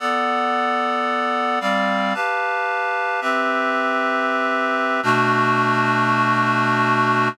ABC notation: X:1
M:3/4
L:1/8
Q:1/4=112
K:Bm
V:1 name="Clarinet"
[B,Adf]6 | [G,=Cd=f]2 [GBfa]4 | "^rit." [=CGBe]6 | [B,,A,DF]6 |]